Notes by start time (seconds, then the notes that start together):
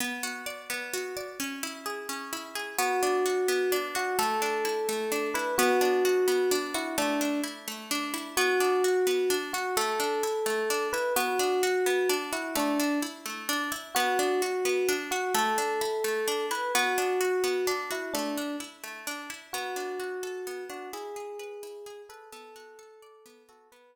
0.00 B3
0.23 F#4
0.46 D5
0.70 B3
0.94 F#4
1.17 D5
1.40 C#4
1.63 E4
1.86 G#4
2.09 C#4
2.33 E4
2.55 G#4
2.78 B3 F#4
3.03 D4
3.26 F#4
3.48 B3
3.72 D4
3.95 F#4
4.19 A3 A4
4.42 D4
4.65 E4
4.89 A3
5.12 D4
5.34 E4 B4
5.58 B3 F#4
5.81 D4
6.05 F#4
6.28 B3
6.51 D4
6.74 E4 F#4
6.98 A3 D4
7.21 D4
7.44 E4
7.68 A3
7.91 D4
8.14 E4
8.37 B3 F#4
8.60 D4
8.84 F#4
9.07 B3
9.30 D4
9.53 F#4
9.77 A3 A4
10.00 D4
10.23 E4
10.46 A3
10.70 D4
10.93 E4 B4
11.16 B3 F#4
11.39 D4
11.63 F#4
11.86 B3
12.09 D4
12.32 E4 F#4
12.55 A3 D4
12.80 D4
13.02 E4
13.26 A3
13.49 D4
13.72 E4
13.95 B3 F#4
14.19 D4
14.42 F#4
14.65 B3
14.89 D4
15.11 F#4
15.34 A3 A4
15.58 D4
15.81 E4
16.04 A3
16.28 D4
16.51 E4 B4
16.75 B3 F#4
16.98 D4
17.21 F#4
17.44 B3
17.67 D4
17.91 E4 F#4
18.14 A3 D4
18.37 D4
18.60 E4
18.84 A3
19.07 D4
19.30 E4
19.53 B3 F#4
19.76 D4
20.00 F#4
20.23 A4
20.47 B3
20.69 D4 F#4
20.93 E4 G#4
21.16 G#4
21.39 B4
21.63 E4
21.86 G#4
22.09 A4 B4
22.32 B3 A4
22.56 F#4
22.79 A4
23.02 D5
23.26 B3
23.49 F#4 A4
23.72 B3 B4